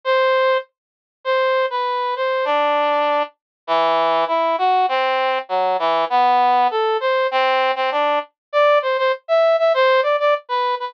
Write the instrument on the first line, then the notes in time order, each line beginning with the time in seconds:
brass section
0.04 C5
1.24 C5
1.70 B4
2.16 C5
2.45 D4
3.67 E3
4.28 E4
4.58 F#4
4.89 C4
5.49 F#3
5.79 E3
6.10 B3
6.71 A4
7.00 C5
7.31 C4
7.76 C4
7.91 D4
8.53 D5
8.82 C5
8.98 C5
9.28 E5
9.59 E5
9.74 C5
10.03 D5
10.20 D5
10.49 B4
10.80 B4